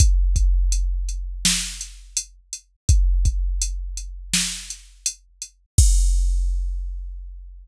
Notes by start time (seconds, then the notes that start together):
0.00 kick, closed hi-hat
0.36 kick, closed hi-hat
0.72 closed hi-hat
1.09 closed hi-hat
1.45 snare
1.81 closed hi-hat
2.17 closed hi-hat
2.53 closed hi-hat
2.89 kick, closed hi-hat
3.25 kick, closed hi-hat
3.62 closed hi-hat
3.97 closed hi-hat
4.33 snare
4.70 closed hi-hat
5.06 closed hi-hat
5.42 closed hi-hat
5.78 kick, crash